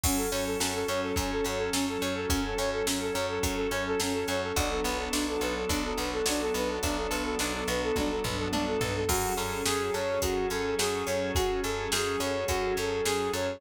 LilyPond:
<<
  \new Staff \with { instrumentName = "Flute" } { \time 4/4 \key fis \minor \tempo 4 = 106 cis'16 a'16 cis''16 a'16 cis'16 a'16 cis''16 a'16 cis'16 a'16 cis''16 a'16 cis'16 a'16 cis''16 a'16 | cis'16 a'16 cis''16 a'16 cis'16 a'16 cis''16 a'16 cis'16 a'16 cis''16 a'16 cis'16 a'16 cis''16 a'16 | d'16 a'16 b'16 a'16 d'16 a'16 b'16 a'16 d'16 a'16 b'16 a'16 d'16 a'16 b'16 a'16 | d'16 a'16 b'16 a'16 d'16 a'16 b'16 a'16 d'16 a'16 b'16 a'16 d'16 a'16 b'16 a'16 |
fis'8 a'8 gis'8 cis''8 fis'8 a'8 gis'8 cis''8 | fis'8 a'8 gis'8 cis''8 fis'8 a'8 gis'8 cis''8 | }
  \new Staff \with { instrumentName = "Drawbar Organ" } { \time 4/4 \key fis \minor <fis cis' a'>1~ | <fis cis' a'>1 | <fis b d' a'>1~ | <fis b d' a'>1 |
<fis cis' gis' a'>1~ | <fis cis' gis' a'>1 | }
  \new Staff \with { instrumentName = "Acoustic Guitar (steel)" } { \time 4/4 \key fis \minor fis8 cis'8 a'8 cis'8 fis8 cis'8 a'8 cis'8 | fis8 cis'8 a'8 cis'8 fis8 cis'8 a'8 cis'8 | fis8 b8 d'8 a'8 d'8 b8 fis8 b8 | d'8 a'8 d'8 b8 fis8 b8 d'8 a'8 |
fis8 cis'8 gis'8 a'8 gis'8 cis'8 fis8 cis'8 | gis'8 a'8 gis'8 cis'8 fis8 cis'8 gis'8 a'8 | }
  \new Staff \with { instrumentName = "Electric Bass (finger)" } { \clef bass \time 4/4 \key fis \minor fis,8 fis,8 fis,8 fis,8 fis,8 fis,8 fis,8 fis,8 | fis,8 fis,8 fis,8 fis,8 fis,8 fis,8 fis,8 fis,8 | b,,8 b,,8 b,,8 b,,8 b,,8 b,,8 b,,8 b,,8 | b,,8 b,,8 b,,8 b,,8 b,,8 b,,8 b,,8 b,,8 |
fis,8 fis,8 fis,8 fis,8 fis,8 fis,8 fis,8 fis,8 | fis,8 fis,8 fis,8 fis,8 fis,8 fis,8 fis,8 fis,8 | }
  \new Staff \with { instrumentName = "String Ensemble 1" } { \time 4/4 \key fis \minor <fis cis' a'>1~ | <fis cis' a'>1 | <fis b d' a'>1~ | <fis b d' a'>1 |
<fis cis' gis' a'>1~ | <fis cis' gis' a'>1 | }
  \new DrumStaff \with { instrumentName = "Drums" } \drummode { \time 4/4 <cymc bd>8 hh8 sn8 hh8 <hh bd>8 hh8 sn8 hh8 | <hh bd>8 hh8 sn8 hh8 <hh bd>8 hh8 sn8 hh8 | <hh bd>8 hh8 sn8 hh8 <hh bd>8 hh8 sn8 hh8 | <hh bd>8 hh8 sn8 hh8 <bd tommh>8 tomfh8 tommh8 tomfh8 |
<cymc bd>8 hh8 sn8 hh8 <hh bd>8 hh8 sn8 hh8 | <hh bd>8 hh8 sn8 hh8 <hh bd>8 hh8 sn8 hh8 | }
>>